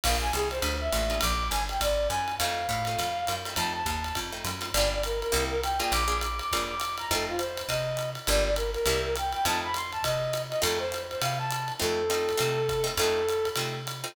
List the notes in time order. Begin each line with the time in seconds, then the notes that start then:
0.03 A#1 A#3 D4 F4 G#4 F5, kick, crash, ride
0.21 G#5
0.33 C2 G#4, hi-hat pedal, ride
0.51 C5, ride
0.62 D2, ride
0.81 E5
0.92 A1 A#3 D4 F4 G#4, hi-hat pedal, ride
1.10 A#3 D4 F4 G#4, ride
1.21 A#1 D6, kick, ride
1.50 G1 G#5, hi-hat pedal, ride
1.69 G5, ride
1.80 G#1 D5, kick, ride
2.09 F#2 G#5, hi-hat pedal, ride
2.28 ride
2.38 F2 A3 C4 D#4 F4 F5, ride
2.69 A2, kick, hi-hat pedal, ride
2.85 A3 C4 D#4 F4, ride
2.99 F2, ride
3.27 F#2, hi-hat pedal, ride
3.45 A3 C4 D#4 F4, ride
3.56 F2 A3 C4 D#4 F4 A5, ride
3.74 A5
3.86 D#2, kick, hi-hat pedal, ride
4.04 ride
4.15 F2, kick, ride
4.32 A3 C4 D#4 F4
4.45 F#2, hi-hat pedal, ride
4.61 A3 C4 D#4 F4, ride
4.74 G1 A#3 D4 F4 G4 D5, ride
4.92 D5
5.03 A#4, hi-hat pedal, ride
5.21 A#4, ride
5.32 C2 A#3 C4 E4 G4, ride
5.50 A#4
5.63 G5, hi-hat pedal, ride
5.79 A#3 D4 F4 G#4 G5, ride
5.92 A#1 D6, ride
6.08 A#3 D4 F4 G#4
6.21 D6, hi-hat pedal, ride
6.39 D6, ride
6.52 F2 A#3 D4 F4 G#4, kick, ride
6.69 D6
6.80 hi-hat pedal, ride
6.98 A#5, ride
7.11 F2 A3 C4 D#4 F4 A4, kick, ride
7.29 F4
7.38 C5, hi-hat pedal, ride
7.57 ride
7.68 C3 D#5, kick, ride
7.97 hi-hat pedal, ride
8.15 ride
8.27 G1 G3 A#3 D4 F4 D5, ride
8.45 D5
8.56 A#4, hi-hat pedal, ride
8.73 A#4, ride
8.86 C2 G3 A#3 C4 E4, ride
9.05 A#4
9.16 G5, hi-hat pedal, ride
9.32 G5, ride
9.45 F2 A3 C4 D#4 F4 A5, ride
9.64 B5
9.74 C6, hi-hat pedal, ride
9.92 A5, ride
10.03 C3 D#5, kick, ride
10.33 hi-hat pedal, ride
10.50 D#5, ride
10.62 F2 A3 C4 D#4 F4 A4, ride
10.79 C5
10.92 hi-hat pedal, ride
11.10 C5, ride
11.22 C3 F5, ride
11.38 A5
11.51 hi-hat pedal, ride
11.68 ride
11.79 F2 A3 C4 D#4 F4 A4
12.10 A3 C4 D#4 F4, hi-hat pedal, ride
12.29 ride
12.37 C3 A3 C4 D#4 F4, ride
12.69 kick, hi-hat pedal, ride
12.84 A3 C4 D#4 F4, ride
12.97 F2 A3 C4 D#4 F4 A4, ride
13.29 hi-hat pedal, ride
13.45 ride
13.56 C3 A3 C4 D#4 F4, ride
13.87 hi-hat pedal, ride
14.04 A3 C4 D#4 F4, ride